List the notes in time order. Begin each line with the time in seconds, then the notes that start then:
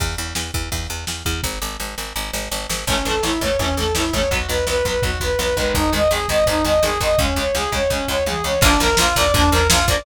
0.00 E2, kick, ride
0.18 E2
0.35 E2, snare
0.54 E2, kick
0.72 E2, kick, ride
0.90 E2
1.07 E2, snare
1.25 E2, kick
1.43 G#1, kick, snare
1.62 G#1
1.80 G#1, snare
1.98 G#1, snare
2.16 G#1
2.33 G#1, snare
2.51 G#1, snare
2.69 G#1, snare
2.87 A1 E3 A3 C#4, kick, crash
2.91 C#4
3.05 A1 E3 A3 A4, floor tom
3.10 C#4
3.23 A1 E3 A3 C#4 E4, snare
3.41 A1 E3 A3 C#5, kick, floor tom
3.45 C#4
3.59 A1 E3 A3 C#4, kick, floor tom
3.63 C#4
3.77 A1 E3 A3 A4, floor tom
3.81 C#4
3.95 A1 E3 A3 E4, snare
3.99 C#4
4.13 A1 E3 A3 C#4 C#5, kick, floor tom
4.31 B1 F#3 B3 F#4, kick, floor tom
4.49 B1 F#3 B3 B4, floor tom
4.67 B1 F#3 B3 B4, snare
4.85 B1 F#3 B3 B4, kick, floor tom
5.02 B1 F#3 B3 F#4, kick, floor tom
5.20 B1 F#3 B3 B4, kick, floor tom
5.39 B1 F#3 B3 B4, snare
5.56 B1 D#3 G#3 B4, kick, floor tom
5.74 G#1 D#4, kick, floor tom
5.92 G#1 D#3 G#3 D#5, floor tom
6.11 G#1 D#3 G#3 G#4, snare
6.28 G#1 D#3 G#3 D#5, kick, floor tom
6.46 G#1 D#3 G#3 D#4, kick, floor tom
6.64 G#1 D#3 G#3 D#5, floor tom
6.82 G#1 D#3 G#3 G#4, snare
7.00 G#1 D#3 G#3 D#5, kick, floor tom
7.18 C#2 C#3 G#3 C#4, kick, floor tom
7.36 C#2 C#3 G#3 C#5, floor tom
7.55 C#2 C#3 G#3 G#4, snare
7.72 C#2 C#3 G#3 C#5, kick, floor tom
7.90 C#2 C#3 G#3 C#4, kick
8.08 C#2 C#3 G#3 C#5, floor tom
8.26 C#2 C#3 G#3 G#4, high tom
8.44 C#2 C#3 G#3 C#5
8.61 A#1 F3 A#3 D4, kick, crash
8.66 D4
8.80 A#1 F3 A#3 D4 A#4, floor tom
8.97 A#1 F3 A#3 F4, snare
9.02 D4
9.16 A#1 F3 A#3 D5, kick, floor tom
9.20 D4
9.34 A#1 F3 A#3 D4, kick, floor tom
9.51 A#1 F3 A#3 A#4, floor tom
9.56 D4
9.70 A#1 F3 A#3 F4, snare
9.74 D4
9.87 A#1 F3 A#3 D5, kick, floor tom
9.92 D4